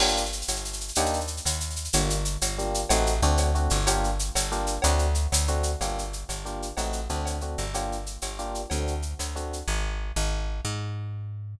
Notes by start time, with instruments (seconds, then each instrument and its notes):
0.00 electric bass (finger) G1, electric piano 1 A#3 D4 F4 G4, crash, cowbell
0.08 shaker
0.17 shaker
0.26 shaker
0.32 shaker
0.42 shaker
0.48 electric bass (finger) G1, cowbell, shaker
0.56 shaker
0.65 shaker
0.73 shaker
0.81 shaker
0.88 shaker
0.95 electric bass (finger) D#2, electric piano 1 A#3 D4 D#4 G4, cowbell, shaker
1.06 shaker
1.13 shaker
1.20 shaker
1.27 shaker
1.37 shaker
1.45 electric bass (finger) D#2, cowbell, shaker
1.53 shaker
1.60 shaker
1.70 shaker
1.76 shaker
1.85 shaker
1.93 electric bass (finger) G1, electric piano 1 A#3 D4 F4 G4, cowbell, shaker
2.10 shaker
2.25 shaker
2.41 electric bass (finger) G1, cowbell, shaker
2.58 electric piano 1 A#3 D4 F4 G4, shaker
2.74 shaker
2.89 electric bass (finger) A1, electric piano 1 A3 C4 D#4 F#4, cowbell, shaker
3.06 shaker
3.22 electric bass (finger) D2, electric piano 1 A3 C4 D4 F#4, shaker
3.37 cowbell, shaker
3.55 electric piano 1 A3 C4 D4 F#4, shaker
3.70 electric bass (finger) G1, shaker
3.87 electric piano 1 A#3 D4 F4 G4, cowbell, shaker
4.04 shaker
4.19 shaker
4.35 electric bass (finger) G1, cowbell, shaker
4.52 electric piano 1 A#3 D4 F4 G4, shaker
4.67 shaker
4.82 electric bass (finger) D2, electric piano 1 A3 C4 D4 F#4, cowbell, shaker
4.99 shaker
5.15 shaker
5.32 electric bass (finger) D2, cowbell, shaker
5.47 electric piano 1 A3 C4 D4 F#4, shaker
5.63 shaker
5.81 electric bass (finger) G1, electric piano 1 A#3 D4 F4 G4, cowbell, shaker
5.98 shaker
6.13 shaker
6.29 electric bass (finger) G1, cowbell, shaker
6.45 electric piano 1 A#3 D4 F4 G4, shaker
6.62 shaker
6.77 electric bass (finger) A1, electric piano 1 A3 C4 D#4 F#4, cowbell, shaker
6.93 shaker
7.09 electric bass (finger) D2, electric piano 1 A3 C4 D4 F#4, shaker
7.25 cowbell, shaker
7.41 electric piano 1 A3 C4 D4 F#4, shaker
7.58 electric bass (finger) G1, shaker
7.74 electric piano 1 A#3 D4 F4 G4, cowbell, shaker
7.92 shaker
8.06 shaker
8.22 electric bass (finger) G1, cowbell, shaker
8.39 electric piano 1 A#3 D4 F4 G4, shaker
8.55 shaker
8.70 electric bass (finger) D2, electric piano 1 A3 C4 D4 F#4, cowbell, shaker
8.87 shaker
9.02 shaker
9.19 electric bass (finger) D2, cowbell, shaker
9.35 electric piano 1 A3 C4 D4 F#4, shaker
9.53 shaker
9.68 electric bass (finger) G#1
10.16 electric bass (finger) G#1
10.65 electric bass (finger) G#2